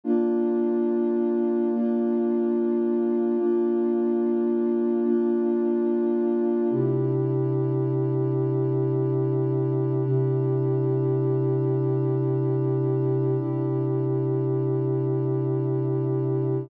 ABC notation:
X:1
M:6/8
L:1/8
Q:3/8=72
K:Bb
V:1 name="Pad 2 (warm)"
[B,DF]6 | [B,DF]6 | [B,DF]6 | [B,DF]6 |
[K:C] [C,DEG]6- | [C,DEG]6 | [C,DEG]6- | [C,DEG]6 |
[C,DEG]6- | [C,DEG]6 |]